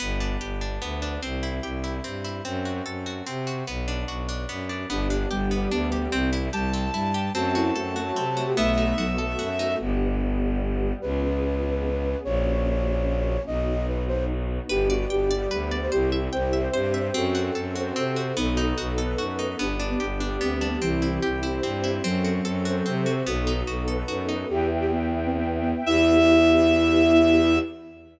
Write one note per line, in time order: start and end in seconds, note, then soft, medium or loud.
0.00 0.37 G1 medium
0.00 0.81 B3 loud
0.20 0.61 D4 medium
0.41 0.78 G1 medium
0.41 1.18 G4 medium
0.61 1.02 D4 medium
0.81 1.18 D2 medium
0.81 1.20 B3 medium
1.02 1.21 D4 medium
1.22 1.60 C2 medium
1.22 2.04 C4 medium
1.43 1.83 E4 medium
1.63 2.00 C2 medium
1.63 2.41 G4 medium
1.84 2.24 E4 medium
2.04 2.41 G2 medium
2.04 2.43 C4 medium
2.24 2.44 E4 medium
2.45 2.82 F#2 medium
2.45 3.26 C4 medium
2.65 3.06 F#4 medium
2.86 3.22 F#2 medium
2.86 3.63 A4 medium
3.06 3.46 F#4 medium
3.27 3.63 C3 medium
3.27 3.65 C4 medium
3.47 3.66 F#4 medium
3.67 4.04 B1 medium
3.67 4.48 B3 medium
3.88 4.28 D4 medium
4.08 4.45 B1 medium
4.08 4.86 F#4 medium
4.29 4.69 D4 medium
4.49 4.86 F#2 medium
4.49 4.88 B3 medium
4.69 4.89 D4 medium
4.89 5.26 G1 medium
4.89 5.08 B3 medium
4.89 5.51 B3 medium
4.89 5.07 D4 medium
4.89 5.51 D4 loud
4.89 5.51 G4 medium
5.10 5.29 D4 medium
5.31 5.67 G1 medium
5.31 5.71 G3 medium
5.31 5.49 G4 medium
5.51 6.12 G3 medium
5.51 5.69 B3 medium
5.51 6.12 B3 loud
5.51 6.12 G4 loud
5.71 6.08 D2 medium
5.71 6.05 B3 medium
5.71 5.90 D4 medium
5.92 6.10 G4 medium
6.12 6.49 C2 medium
6.12 6.29 C4 medium
6.12 6.31 C4 loud
6.33 6.51 E4 medium
6.53 6.90 C2 medium
6.53 6.88 G3 medium
6.53 6.71 G4 medium
6.53 7.31 A5 medium
6.73 6.92 C4 medium
6.93 7.30 G2 medium
6.93 7.32 G3 medium
6.93 7.12 E4 medium
7.14 7.33 G4 medium
7.35 7.72 F#2 medium
7.35 7.95 A3 loud
7.35 7.95 C4 loud
7.35 8.16 C4 loud
7.35 7.52 F#4 medium
7.35 7.95 F#4 medium
7.35 8.49 A5 medium
7.55 7.72 E4 medium
7.55 7.95 F#4 medium
7.75 8.12 F#2 medium
7.75 8.14 F#4 medium
7.75 8.53 A4 medium
7.96 8.57 F#3 loud
7.96 8.56 A3 medium
7.96 8.36 F#4 medium
7.96 8.56 F#4 medium
8.16 8.53 C3 medium
8.16 8.55 C4 medium
8.37 8.56 F#4 medium
8.47 8.56 G4 medium
8.57 8.93 B1 medium
8.57 9.17 A3 loud
8.57 8.95 A3 medium
8.57 9.17 B3 loud
8.57 9.73 B3 loud
8.57 9.17 D#4 medium
8.57 9.17 F#4 medium
8.57 9.76 E5 medium
8.78 9.59 D#4 medium
8.98 9.35 B1 medium
8.98 9.16 F#3 medium
8.98 9.38 F#4 medium
9.18 9.79 A3 medium
9.18 9.79 B3 medium
9.18 9.79 F#4 medium
9.18 9.77 A4 medium
9.18 9.79 A4 medium
9.39 9.76 F#2 medium
9.39 9.78 F#4 medium
9.59 9.79 D#4 medium
9.80 10.92 G1 medium
9.80 10.40 B3 medium
9.80 10.93 B3 medium
9.80 10.40 D4 medium
9.80 10.40 G4 medium
10.41 11.02 G3 medium
10.41 11.02 B3 medium
10.41 11.02 G4 medium
11.02 12.15 C#2 medium
11.02 11.62 B3 medium
11.02 11.62 C#4 medium
11.02 11.63 F4 medium
11.02 11.62 G#4 medium
11.02 12.18 B4 medium
11.63 12.23 B3 medium
11.63 12.23 C#4 medium
11.63 12.23 G#4 medium
11.63 12.23 B4 medium
12.24 13.37 A#1 loud
12.24 13.46 A#3 medium
12.24 13.46 C#4 medium
12.24 13.46 F#4 medium
12.24 13.42 C#5 medium
13.46 14.59 B1 medium
13.46 14.68 B3 medium
13.46 14.68 D#4 medium
13.46 14.68 F#4 medium
13.46 13.86 D#5 medium
13.88 14.04 B4 medium
14.08 14.25 C5 medium
14.69 15.06 G1 medium
14.69 15.30 B3 medium
14.69 15.30 D4 medium
14.69 14.87 G4 medium
14.69 15.30 G4 loud
14.69 15.51 B4 loud
14.90 15.07 F#4 medium
14.90 15.30 D5 loud
15.10 15.47 G1 medium
15.10 15.48 G4 medium
15.10 15.88 G5 medium
15.31 15.91 G3 loud
15.31 15.91 B3 medium
15.31 15.91 G4 medium
15.31 15.71 D5 medium
15.51 15.88 D2 medium
15.51 15.90 B4 loud
15.71 15.91 D5 medium
15.81 15.91 C5 medium
15.92 16.29 C2 medium
15.92 16.53 C4 loud
15.92 16.53 E4 loud
15.92 16.10 G4 medium
15.92 16.53 G4 medium
15.92 16.73 C5 loud
16.12 16.53 E5 loud
16.32 16.69 C2 medium
16.32 16.67 C5 medium
16.32 17.10 G5 medium
16.53 17.14 C4 loud
16.53 17.14 G4 loud
16.53 17.14 C5 loud
16.53 16.93 E5 medium
16.73 17.10 G2 medium
16.73 17.12 C5 medium
16.73 17.08 C5 medium
16.94 17.13 E5 medium
17.14 17.51 F#2 medium
17.14 17.75 C4 medium
17.14 17.95 C4 loud
17.14 18.17 F#4 medium
17.14 17.75 F#4 loud
17.14 17.75 A4 loud
17.35 17.75 F#4 medium
17.55 17.92 F#2 medium
17.55 18.33 A4 medium
17.75 18.36 C4 loud
17.75 18.16 F#4 medium
17.75 18.36 A4 loud
17.75 18.36 C5 loud
17.96 18.33 C3 medium
17.96 18.35 C4 loud
18.16 18.36 F#4 medium
18.36 18.73 B1 medium
18.36 18.97 B3 medium
18.36 19.53 B3 loud
18.36 18.97 D#4 medium
18.36 18.73 D#4 medium
18.36 18.97 F#4 loud
18.36 18.97 A4 medium
18.57 19.38 D#4 medium
18.78 19.15 B1 medium
18.78 19.18 F#4 medium
18.98 19.58 B3 medium
18.98 19.59 D#4 medium
18.98 19.56 A4 medium
18.98 19.59 A4 medium
18.98 19.59 B4 loud
19.18 19.55 F#2 medium
19.18 19.57 F#4 medium
19.39 19.58 D#4 medium
19.59 19.96 G1 medium
19.59 20.19 B3 medium
19.59 20.40 B3 loud
19.59 20.19 D4 medium
19.59 19.75 D4 medium
19.59 20.19 G4 medium
19.80 20.20 D4 medium
19.90 20.00 B3 medium
20.00 20.37 G1 medium
20.00 20.78 G4 medium
20.20 20.81 G3 loud
20.20 20.81 B3 medium
20.20 20.61 D4 medium
20.20 20.81 G4 loud
20.41 20.77 D2 medium
20.41 20.80 B3 medium
20.41 20.54 C4 medium
20.54 20.67 C4 medium
20.61 20.81 D4 medium
20.68 20.81 B3 medium
20.81 21.18 C2 medium
20.81 21.20 E3 medium
20.81 21.42 C4 medium
20.81 21.63 C4 medium
20.81 21.42 E4 loud
20.81 21.42 G4 medium
21.02 21.42 E4 medium
21.22 21.60 C2 medium
21.22 22.00 G4 medium
21.43 22.03 C4 medium
21.43 21.83 E4 medium
21.43 22.03 G4 medium
21.43 22.03 C5 medium
21.63 22.00 G2 medium
21.63 22.02 C4 medium
21.84 22.03 E4 medium
22.04 22.41 F#2 medium
22.04 23.06 F#3 medium
22.04 22.85 C4 loud
22.04 22.65 C4 medium
22.04 22.65 F#4 medium
22.04 22.65 A4 medium
22.24 22.65 F#4 medium
22.45 22.82 F#2 medium
22.45 23.22 A4 medium
22.65 23.26 C4 medium
22.65 23.06 F#4 medium
22.65 23.26 A4 loud
22.65 23.26 C5 loud
22.85 23.22 C3 medium
22.85 23.24 C4 medium
23.06 23.26 F#4 medium
23.26 23.63 B1 medium
23.26 23.87 B3 medium
23.26 24.43 B3 loud
23.26 23.87 D#4 medium
23.26 23.87 F#4 medium
23.26 23.60 F#4 medium
23.26 23.87 A4 medium
23.47 24.28 D#4 medium
23.67 24.04 B1 medium
23.67 24.08 F#4 medium
23.88 24.48 B3 medium
23.88 24.48 D#4 loud
23.88 24.48 A4 medium
23.88 24.46 A4 medium
23.88 24.48 B4 medium
24.08 24.45 F#2 medium
24.08 24.47 F#4 medium
24.29 24.48 D#4 medium
24.49 25.74 E2 medium
24.49 24.69 G4 medium
24.49 25.85 B4 medium
24.49 25.85 E5 medium
24.49 25.85 G5 medium
24.80 24.90 G4 medium
24.92 25.19 B3 medium
25.25 25.36 C4 medium
25.37 25.58 B3 medium
25.61 25.83 B3 medium
25.86 27.59 E2 loud
25.86 27.59 B3 loud
25.86 27.59 E4 loud
25.86 27.59 G4 loud
25.86 27.59 E5 loud